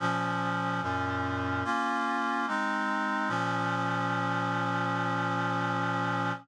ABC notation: X:1
M:4/4
L:1/8
Q:1/4=73
K:Bbm
V:1 name="Clarinet"
[B,,F,D]2 [G,,B,,D]2 [B,DF]2 [A,CE]2 | [B,,F,D]8 |]